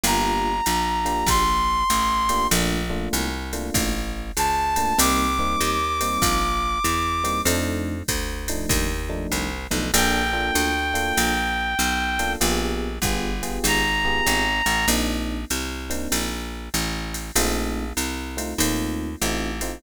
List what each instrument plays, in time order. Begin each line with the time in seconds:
0.04 electric bass (finger) G1, electric piano 1 A#3 D4 F4 G4, brass section A#5, ride
0.66 electric bass (finger) A#1, hi-hat pedal, ride
1.05 electric piano 1 A#3 D4 F4 G4, ride
1.27 electric bass (finger) A#1, brass section C6, kick, ride
1.90 electric bass (finger) A1, hi-hat pedal, ride
2.29 electric piano 1 A#3 D4 F4 G4, ride
2.51 electric bass (finger) A#1, electric piano 1 A3 A#3 D4 F4, ride
2.90 electric piano 1 A3 A#3 D4 F4
3.13 electric bass (finger) C2, hi-hat pedal, ride
3.53 electric piano 1 A3 A#3 D4 F4, ride
3.74 electric bass (finger) A1, kick, ride
4.37 electric bass (finger) C#2, brass section A5, hi-hat pedal, ride
4.76 electric piano 1 A3 A#3 D4 F4, ride
4.98 electric bass (finger) C2, electric piano 1 G3 A#3 C4 D#4, brass section D6, ride
5.39 electric piano 1 G3 A#3 C4 D#4
5.61 electric bass (finger) D#2, hi-hat pedal, ride
6.01 electric piano 1 G3 A#3 C4 D#4, ride
6.22 electric bass (finger) A#1, kick, ride
6.84 electric bass (finger) E2, hi-hat pedal, ride
7.24 electric piano 1 G3 A#3 C4 D#4, ride
7.45 electric bass (finger) F2, electric piano 1 F3 A3 D4 D#4, ride
8.08 electric bass (finger) D2, kick, hi-hat pedal, ride
8.48 electric piano 1 F3 A3 D4 D#4, ride
8.69 electric bass (finger) D#2, kick, ride
9.09 electric piano 1 F3 A3 D4 D#4
9.32 electric bass (finger) C2, hi-hat pedal, ride
9.71 electric bass (finger) B1, electric piano 1 F3 A3 D4 D#4, ride
9.94 electric bass (finger) A#1, electric piano 1 A#3 D4 F4 A4, clarinet G5, ride
10.33 electric piano 1 A#3 D4 F4 A4
10.55 electric bass (finger) D2, hi-hat pedal, ride
10.94 electric piano 1 A#3 D4 F4 A4, ride
11.17 electric bass (finger) A#1, ride
11.79 electric bass (finger) B1, hi-hat pedal, ride
12.19 electric piano 1 A#3 D4 F4 A4, ride
12.41 electric bass (finger) A#1, electric piano 1 B3 F4 G4 G#4, ride
13.02 electric bass (finger) G1, electric piano 1 B3 F4 G4 G#4, kick, hi-hat pedal, ride
13.43 electric piano 1 B3 F4 G4 G#4, ride
13.64 electric bass (finger) G#1, clarinet A#5, ride
14.05 electric piano 1 B3 F4 G4 G#4
14.26 electric bass (finger) G#1, hi-hat pedal, ride
14.66 electric bass (finger) A1, ride
14.88 electric bass (finger) A#1, electric piano 1 A#3 C4 D4 D#4, ride
15.50 electric bass (finger) C2, hi-hat pedal, ride
15.90 electric piano 1 A#3 C4 D4 D#4, ride
16.12 electric bass (finger) A#1, ride
16.74 electric bass (finger) A1, hi-hat pedal, ride
17.14 ride
17.36 electric bass (finger) A#1, electric piano 1 A3 C4 D#4 F4, ride
17.97 electric bass (finger) C2, hi-hat pedal, ride
18.37 electric piano 1 A3 C4 D#4 F4, ride
18.58 electric bass (finger) D#2, electric piano 1 A3 C4 D#4 F4, ride
19.22 electric bass (finger) A1, electric piano 1 A3 C4 D#4 F4, hi-hat pedal, ride
19.61 electric piano 1 A3 C4 D#4 F4, ride